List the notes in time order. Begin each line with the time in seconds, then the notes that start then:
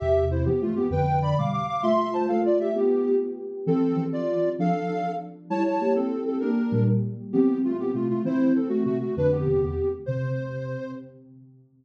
0.00 E2 C3 G4 E5
0.31 E4 C5
0.45 G2 E3 B3 G4
0.61 A3 F4
0.76 B3 G4
0.90 F2 D3 B4 G5
1.22 D5 B5
1.38 B2 G3 F5 D6
1.53 F5 D6
1.68 F5 D6
1.82 A3 F4 E5 C6
2.13 C5 A5
2.28 A3 F4 A4 F5
2.45 F4 D5
2.60 G4 E5
2.75 B3 G4
3.66 E3 C4 A4
3.96 E3 C4
4.13 F4 D5
4.59 F3 D4 A4 F5
4.89 F3 D4
5.50 G3 E4 C#5 A5
5.66 C#5 A5
5.81 A#3 G4
5.95 C4 A4
6.26 C4 A4
6.40 A#3 D4 G4 A#4
6.72 A#2 G3
7.33 E3 B3 C4 G4
7.64 A3 F4
7.79 B3 G4
7.94 C3 A3 F4
8.10 A3 F4
8.24 E3 C4 E4 C5
8.55 C4 A4
8.69 A3 F#4
8.85 C3 A3 F#4
9.01 A3 F#4
9.17 F2 D3 D4 B4
9.31 B3 G4
9.47 E2 C3
9.62 E2 C3 B3 G4
10.06 C3 C5